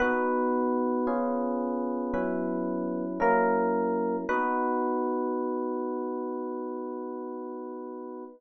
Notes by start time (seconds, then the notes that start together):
0.00 B3 D#4 F#4 B4
1.07 C#4 F4 G#4
2.14 F#3 C#4 E4 B4
3.20 F#3 A#3 C#4 E4 A#4
4.29 B3 D#4 F#4 B4